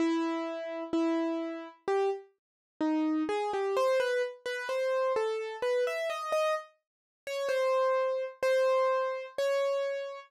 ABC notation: X:1
M:4/4
L:1/16
Q:1/4=64
K:C#m
V:1 name="Acoustic Grand Piano"
E4 E4 =G z3 D2 ^G =G | ^B =B z B ^B2 A2 =B e d d z3 c | ^B4 B4 c4 z4 |]